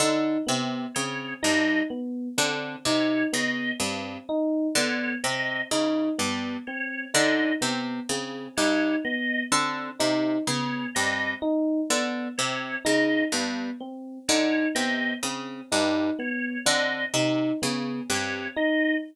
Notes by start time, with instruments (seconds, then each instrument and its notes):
0.00 harpsichord D3, electric piano 1 D#4
0.47 harpsichord C3, electric piano 1 B3
0.95 harpsichord C#3, electric piano 1 C4, drawbar organ C#5
1.43 harpsichord G2, electric piano 1 D#4, drawbar organ D#5
1.90 electric piano 1 B3
2.38 harpsichord D3, electric piano 1 C4
2.85 harpsichord C3, electric piano 1 D#4, drawbar organ C#5
3.33 harpsichord C#3, electric piano 1 B3, drawbar organ D#5
3.80 harpsichord G2, electric piano 1 C4
4.29 electric piano 1 D#4
4.75 harpsichord D3, electric piano 1 B3, drawbar organ C#5
5.24 harpsichord C3, electric piano 1 C4, drawbar organ D#5
5.71 harpsichord C#3, electric piano 1 D#4
6.18 harpsichord G2, electric piano 1 B3
6.67 electric piano 1 C4, drawbar organ C#5
7.14 harpsichord D3, electric piano 1 D#4, drawbar organ D#5
7.61 harpsichord C3, electric piano 1 B3
8.09 harpsichord C#3, electric piano 1 C4
8.57 harpsichord G2, electric piano 1 D#4, drawbar organ C#5
9.05 electric piano 1 B3, drawbar organ D#5
9.52 harpsichord D3, electric piano 1 C4
9.99 harpsichord C3, electric piano 1 D#4
10.47 harpsichord C#3, electric piano 1 B3, drawbar organ C#5
10.95 harpsichord G2, electric piano 1 C4, drawbar organ D#5
11.42 electric piano 1 D#4
11.90 harpsichord D3, electric piano 1 B3
12.38 harpsichord C3, electric piano 1 C4, drawbar organ C#5
12.85 harpsichord C#3, electric piano 1 D#4, drawbar organ D#5
13.32 harpsichord G2, electric piano 1 B3
13.80 electric piano 1 C4
14.28 harpsichord D3, electric piano 1 D#4, drawbar organ C#5
14.75 harpsichord C3, electric piano 1 B3, drawbar organ D#5
15.23 harpsichord C#3, electric piano 1 C4
15.72 harpsichord G2, electric piano 1 D#4
16.19 electric piano 1 B3, drawbar organ C#5
16.66 harpsichord D3, electric piano 1 C4, drawbar organ D#5
17.14 harpsichord C3, electric piano 1 D#4
17.62 harpsichord C#3, electric piano 1 B3
18.10 harpsichord G2, electric piano 1 C4, drawbar organ C#5
18.56 electric piano 1 D#4, drawbar organ D#5